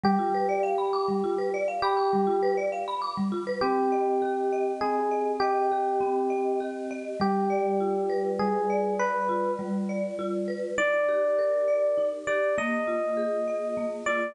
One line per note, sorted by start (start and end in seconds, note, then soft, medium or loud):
0.03 0.17 G3 loud
0.03 1.55 G4 loud
0.19 0.32 F4 medium
0.34 0.48 B4 medium
0.49 0.62 D5 medium
0.63 0.76 F5 medium
0.78 0.92 B5 medium
0.93 1.06 D6 medium
1.08 1.22 G3 medium
1.24 1.37 F4 medium
1.38 1.52 B4 medium
1.54 1.67 D5 medium
1.68 1.81 F5 medium
1.82 2.56 G4 loud
1.82 1.97 B5 medium
1.97 2.10 D6 medium
2.13 2.26 G3 medium
2.27 2.40 F4 medium
2.43 2.56 B4 loud
2.57 2.71 D5 medium
2.72 2.86 F5 medium
2.88 3.01 B5 medium
3.02 3.15 D6 medium
3.17 3.31 G3 medium
3.32 3.45 F4 medium
3.47 3.60 B4 medium
3.61 4.81 C4 medium
3.61 4.72 G4 loud
3.92 4.52 D#5 medium
4.22 5.71 G4 medium
4.52 5.11 D#5 medium
4.81 6.00 C4 medium
4.81 5.32 G#4 medium
5.11 5.41 D#5 medium
5.40 6.60 G4 loud
5.40 6.30 D#5 medium
5.71 6.60 G4 medium
6.00 7.14 C4 medium
6.30 6.90 D#5 medium
6.60 7.17 G4 medium
6.91 7.19 D#5 medium
7.20 8.39 G3 medium
7.20 8.30 G4 medium
7.50 8.69 D5 medium
7.80 9.28 F4 medium
8.10 8.99 B4 medium
8.39 9.58 G3 medium
8.39 8.94 G#4 medium
8.70 9.89 D5 medium
8.99 9.51 B4 medium
8.99 10.47 B4 medium
9.29 10.18 F4 medium
9.59 10.72 G3 medium
9.89 10.74 D5 medium
10.19 10.75 F4 medium
10.48 10.76 B4 medium
10.78 11.97 D#4 medium
10.78 12.07 D5 loud
11.08 12.27 G4 medium
11.39 12.52 A#4 medium
11.68 12.53 D5 medium
11.98 12.54 D#4 medium
12.27 12.56 G4 medium
12.27 12.55 D5 medium
12.58 13.77 A#3 medium
12.58 13.89 D#5 medium
12.87 14.07 F4 medium
13.17 14.30 G#4 medium
13.48 14.33 D#5 medium
13.77 14.34 A#3 medium
14.06 14.35 F4 medium
14.06 14.35 D5 medium